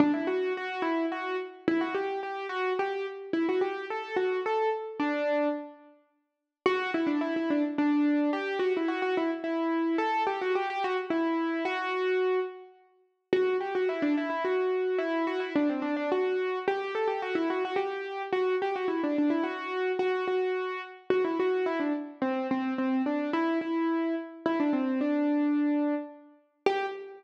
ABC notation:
X:1
M:3/4
L:1/16
Q:1/4=108
K:G
V:1 name="Acoustic Grand Piano"
D E F2 F2 E2 F2 z2 | E F G2 G2 F2 G2 z2 | E F G2 A2 F2 A2 z2 | D4 z8 |
F2 E D E E D z D4 | G2 F E F F E z E4 | A2 G F G G F z E4 | F6 z6 |
[K:Em] F2 G F E D E E F4 | E2 F E D C D D F4 | G2 A G F E F F G4 | F2 G F E D D E F4 |
[K:G] F2 F4 z2 F E F2 | E D z2 C2 C2 C2 D2 | E2 E4 z2 E D C2 | D8 z4 |
G4 z8 |]